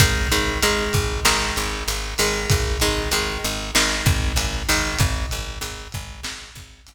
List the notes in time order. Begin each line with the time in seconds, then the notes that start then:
0.00 G#1 D#3 G#3, kick, closed hi-hat
0.32 G#1 D#3 G#3, closed hi-hat
0.62 G#1 D#3 G#3, closed hi-hat
0.93 G#1, kick, closed hi-hat
1.25 G#1 D#3 G#3, snare
1.56 G#1, closed hi-hat
1.88 G#1, closed hi-hat
2.18 G#1 D#3 G#3, open hi-hat
2.50 G#1, kick, closed hi-hat
2.80 G#1 D#3 G#3, closed hi-hat
3.11 G#1 D#3 G#3, closed hi-hat
3.44 G#1, closed hi-hat
3.75 G#1 D#3 G#3, snare
4.06 G#1, kick, closed hi-hat
4.36 G#1, closed hi-hat
4.69 G#1 D#3 G#3, open hi-hat
4.99 G#1, kick, closed hi-hat
5.31 G#1, closed hi-hat
5.61 G#1, closed hi-hat
5.92 G#1, kick, closed hi-hat
6.23 G#1, snare
6.55 G#1, kick, closed hi-hat
6.87 G#1, closed hi-hat